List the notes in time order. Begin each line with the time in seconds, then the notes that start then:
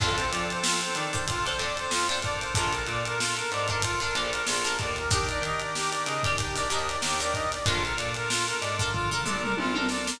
0.00 F2 C4 D4 F4 A4 C5, kick, crash
0.17 C5, closed hi-hat
0.31 F3 D5, closed hi-hat
0.50 C5, closed hi-hat
0.64 F4, snare
0.81 C5, closed hi-hat
0.95 D#3 D5, closed hi-hat
1.12 D4 F4 A4 C5, kick, closed hi-hat
1.28 C4 D4 F4 A4, kick, closed hi-hat
1.45 D4 F4 A4 C5, snare, closed hi-hat
1.59 F2 D4 F4 A4 C5 D5, closed hi-hat
1.77 C5, closed hi-hat
1.91 F2 F4, snare
2.08 D4 F4 A4 C5, snare, closed hi-hat
2.22 D4 F4 A4 A#4 D5, kick, closed hi-hat
2.40 C5, closed hi-hat
2.55 A#1 D4 F4 A4 A#4, kick, closed hi-hat
2.72 A#4, closed hi-hat
2.87 A#2 D5, closed hi-hat
3.05 A#4, closed hi-hat
3.18 F4, snare
3.37 A#4, closed hi-hat
3.51 G#2 D5, closed hi-hat
3.68 D4 F4 A4 A#4, kick, closed hi-hat
3.82 D4 F4 A4 A#4, kick, closed hi-hat
4.00 D4 F4 A4 A#4, snare, closed hi-hat
4.14 A#1 D4 F4 A4 A#4 D5, closed hi-hat
4.33 A#4, closed hi-hat
4.47 A#1 F4, snare
4.64 D4 F4 A4 A#4, snare, closed hi-hat
4.79 D#2 D5, kick, closed hi-hat
4.96 A#4, closed hi-hat
5.11 D4 D#4 G4 A#4, kick, closed hi-hat
5.29 D5, closed hi-hat
5.42 D#3 D#5, closed hi-hat
5.60 D5, closed hi-hat
5.75 G4, snare
5.92 D5, closed hi-hat
6.06 C#3 D#5, closed hi-hat
6.23 D4 D#4 G4 A#4 D5, kick, closed hi-hat
6.38 D4 D#4 G4 A#4, kick, closed hi-hat
6.56 D4 D#4 G4 A#4 D5, snare, closed hi-hat
6.70 D#2 D4 D#4 G4 A#4 D#5, closed hi-hat
6.88 D5, closed hi-hat
7.02 D#2 G4, snare
7.20 D4 D#4 G4 A#4 D5, closed hi-hat
7.34 D#5, kick, closed hi-hat
7.52 D5, snare, closed hi-hat
7.66 A#1 D4 F4 A4 A#4, kick, closed hi-hat
7.83 A#4, snare, closed hi-hat
7.97 A#2 D5, closed hi-hat
8.14 A#4, snare, closed hi-hat
8.30 F4, snare
8.47 A#4, closed hi-hat
8.61 G#2 D5, closed hi-hat
8.79 D4 F4 A4 A#4, kick, closed hi-hat
8.92 D4 F4 A4 A#4, kick, floor tom
9.11 D4 F4 A4 A#4, floor tom
9.26 A#1 D4 F4 A4 A#4 D5, mid tom
9.42 A#4, mid tom
9.57 A#1 F4, high tom
9.74 D4 F4 A4 A#4, high tom
9.89 D5, snare
10.07 A#4, snare